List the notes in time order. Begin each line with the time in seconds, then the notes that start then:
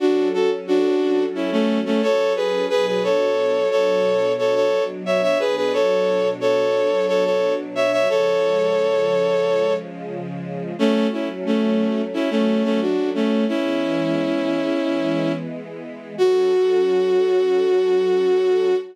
0.00 F#3 C#4 D4 F#4 A4
0.34 F#4 A4
0.67 D4 F#4
1.35 C#4 E4
1.52 A3 C#4
1.85 A3 C#4
2.02 A4 C#5
2.36 G#4 B4
2.70 B2 F#3 D4 G#4 B4
2.87 G#4 B4
3.03 A4 C#5
3.71 A4 C#5
4.38 A4 C#5
4.55 A4 C#5
5.06 C#5 E5
5.22 C#5 E5
5.39 B2 F#3 D4 G#4 B4
5.56 G#4 B4
5.73 A4 C#5
6.40 A4 C#5
7.08 A4 C#5
7.25 A4 C#5
7.75 C#5 E5
7.92 C#5 E5
8.07 C#3 F3 G#3 A4 C#5
10.78 F#3 A3 C#4
11.12 C#4 E4
11.46 A3 C#4
12.13 C#4 E4
12.30 A3 C#4
12.64 A3 C#4
12.81 D4 F#4
13.15 A3 C#4
13.48 E3 G#3 B3 C#4 E4
16.18 F#3 C#4 F#4 A4